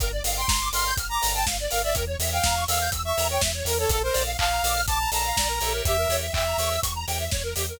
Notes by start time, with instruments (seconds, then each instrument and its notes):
0.00 synth bass 2 G1, drawbar organ A#4 D5 F5 G5, lead 1 (square) A#4, kick, closed hi-hat
0.12 lead 1 (square) D5
0.23 synth bass 2 G1, drawbar organ A#4 D5 F5 G5, lead 1 (square) F5, open hi-hat
0.37 lead 1 (square) G5, lead 2 (sawtooth) C6
0.47 synth bass 2 G1, lead 1 (square) A#5, kick, snare
0.61 lead 1 (square) D6
0.72 synth bass 2 G1, drawbar organ A#4 D5 F5 G5, lead 2 (sawtooth) C6, lead 1 (square) F6, open hi-hat
0.86 lead 1 (square) G6
0.96 synth bass 2 G1, lead 1 (square) F6, kick, closed hi-hat
1.09 lead 2 (sawtooth) A#5, lead 1 (square) D6
1.22 synth bass 2 G1, drawbar organ A#4 D5 F5 G5, lead 1 (square) A#5, open hi-hat
1.33 lead 1 (square) G5, lead 2 (sawtooth) A5
1.46 synth bass 2 G1, lead 1 (square) F5, kick, snare
1.59 lead 1 (square) D5
1.71 synth bass 2 G1, drawbar organ A#4 D5 F5 G5, lead 1 (square) A#4, lead 2 (sawtooth) F5, open hi-hat
1.83 lead 1 (square) D5, lead 2 (sawtooth) E5
1.94 synth bass 2 E2, lead 1 (square) A#4, drawbar organ A#4 C#5 E5 G5, kick, closed hi-hat
2.07 lead 1 (square) C#5
2.19 synth bass 2 E2, drawbar organ A#4 C#5 E5 G5, lead 1 (square) E5, open hi-hat
2.32 lead 2 (sawtooth) F5, lead 1 (square) G5
2.43 synth bass 2 E2, lead 1 (square) A#5, kick, snare
2.55 lead 1 (square) C#6
2.68 synth bass 2 E2, drawbar organ A#4 C#5 E5 G5, lead 2 (sawtooth) F5, lead 1 (square) E6, open hi-hat
2.80 lead 1 (square) G6
2.91 synth bass 2 E2, lead 1 (square) E6, kick, closed hi-hat
3.05 lead 2 (sawtooth) E5, lead 1 (square) C#6
3.17 synth bass 2 E2, drawbar organ A#4 C#5 E5 G5, lead 1 (square) A#5, open hi-hat
3.30 lead 2 (sawtooth) C#5, lead 1 (square) G5
3.41 synth bass 2 E2, lead 1 (square) E5, kick, snare
3.54 lead 1 (square) C#5
3.65 synth bass 2 E2, drawbar organ A#4 C#5 E5 G5, lead 2 (sawtooth) A#4, lead 1 (square) A#4, open hi-hat
3.78 lead 2 (sawtooth) A4, lead 1 (square) C#5
3.89 synth bass 2 A#1, lead 1 (square) A4, drawbar organ A4 A#4 D5 F5, lead 2 (sawtooth) A4, kick, closed hi-hat
4.03 lead 1 (square) A#4, lead 2 (sawtooth) C5
4.13 synth bass 2 A#1, drawbar organ A4 A#4 D5 F5, lead 1 (square) D5, open hi-hat
4.26 lead 1 (square) F5
4.38 synth bass 2 A#1, lead 2 (sawtooth) F5, lead 1 (square) A5, kick, clap
4.52 lead 1 (square) A#5
4.63 synth bass 2 A#1, drawbar organ A4 A#4 D5 F5, lead 1 (square) D6, open hi-hat
4.74 lead 1 (square) F6
4.86 synth bass 2 A#1, lead 2 (sawtooth) A5, lead 1 (square) D6, kick, closed hi-hat
4.99 lead 1 (square) A#5
5.12 synth bass 2 A#1, drawbar organ A4 A#4 D5 F5, lead 1 (square) A5, lead 2 (sawtooth) A#5, open hi-hat
5.25 lead 1 (square) F5
5.37 synth bass 2 A#1, lead 1 (square) D5, kick, snare
5.48 lead 1 (square) A#4
5.61 synth bass 2 A#1, drawbar organ G4 A#4 C#5 E5, lead 1 (square) A4, open hi-hat
5.71 lead 1 (square) A#4
5.85 synth bass 2 E2, lead 1 (square) G4, lead 2 (sawtooth) E5, kick, closed hi-hat
5.97 lead 1 (square) A#4
6.09 synth bass 2 E2, drawbar organ G4 A#4 C#5 E5, lead 1 (square) C#5, open hi-hat
6.22 lead 1 (square) E5
6.32 synth bass 2 E2, lead 2 (sawtooth) E5, lead 1 (square) G5, kick, clap
6.46 lead 1 (square) A#5
6.58 synth bass 2 E2, drawbar organ G4 A#4 C#5 E5, lead 1 (square) C#6, open hi-hat
6.70 lead 1 (square) E6
6.82 synth bass 2 E2, lead 1 (square) C#6, kick, closed hi-hat
6.95 lead 1 (square) A#5
7.08 synth bass 2 E2, drawbar organ G4 A#4 C#5 E5, lead 1 (square) G5, open hi-hat
7.20 lead 1 (square) E5
7.31 synth bass 2 E2, lead 1 (square) C#5, kick, snare
7.43 lead 1 (square) A#4
7.55 synth bass 2 E2, lead 1 (square) G4, drawbar organ G4 A#4 C#5 E5, open hi-hat
7.69 lead 1 (square) A#4